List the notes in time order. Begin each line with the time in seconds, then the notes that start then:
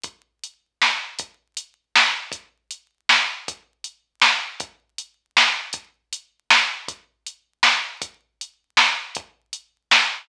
0.04 kick, closed hi-hat
0.44 closed hi-hat
0.82 snare
1.19 kick, closed hi-hat
1.57 closed hi-hat
1.95 snare
2.32 kick, closed hi-hat
2.71 closed hi-hat
3.09 snare
3.48 kick, closed hi-hat
3.84 closed hi-hat
4.22 snare
4.60 kick, closed hi-hat
4.98 closed hi-hat
5.37 snare
5.73 kick, closed hi-hat
6.13 closed hi-hat
6.50 snare
6.88 kick, closed hi-hat
7.27 closed hi-hat
7.63 snare
8.02 kick, closed hi-hat
8.41 closed hi-hat
8.77 snare
9.15 kick, closed hi-hat
9.53 closed hi-hat
9.91 snare